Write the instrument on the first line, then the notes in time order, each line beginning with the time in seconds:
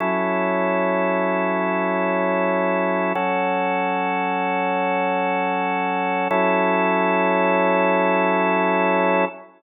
drawbar organ
0.00 F#3 C#4 E4 A4
3.15 F#3 C#4 F#4 A4
6.31 F#3 C#4 E4 A4